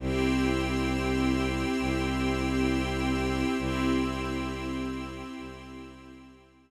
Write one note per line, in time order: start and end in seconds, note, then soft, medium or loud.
0.00 1.65 C2 loud
0.00 3.55 C4 medium
0.00 3.55 E4 medium
0.00 3.55 G4 medium
0.00 3.55 G5 loud
0.00 3.55 C6 medium
0.00 3.55 E6 medium
1.79 3.44 C2 medium
3.58 5.23 C2 loud
3.58 6.71 C4 medium
3.58 6.71 E4 medium
3.58 6.71 G4 medium
3.58 6.71 G5 loud
3.58 6.71 C6 medium
3.58 6.71 E6 medium
5.37 6.71 C2 medium